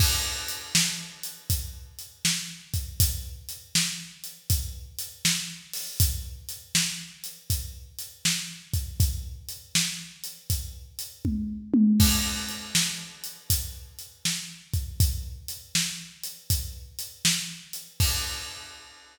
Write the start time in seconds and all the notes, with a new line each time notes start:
0.00 kick, crash
0.48 closed hi-hat
0.75 snare
1.23 closed hi-hat
1.50 kick, closed hi-hat
1.99 closed hi-hat
2.25 snare
2.74 kick, closed hi-hat
3.00 kick, closed hi-hat
3.49 closed hi-hat
3.75 snare
4.24 closed hi-hat
4.50 kick, closed hi-hat
4.99 closed hi-hat
5.25 snare
5.73 open hi-hat
6.00 kick, closed hi-hat
6.49 closed hi-hat
6.75 snare
7.24 closed hi-hat
7.50 kick, closed hi-hat
7.99 closed hi-hat
8.25 snare
8.73 kick, closed hi-hat
9.00 kick, closed hi-hat
9.49 closed hi-hat
9.75 snare
10.24 closed hi-hat
10.50 kick, closed hi-hat
10.99 closed hi-hat
11.25 kick, high tom
11.74 high tom
12.00 kick, crash
12.49 closed hi-hat
12.75 snare
13.24 closed hi-hat
13.50 kick, closed hi-hat
13.99 closed hi-hat
14.25 snare
14.74 kick, closed hi-hat
15.00 kick, closed hi-hat
15.48 closed hi-hat
15.75 snare
16.23 closed hi-hat
16.50 kick, closed hi-hat
16.99 closed hi-hat
17.25 snare
17.73 closed hi-hat
18.00 kick, crash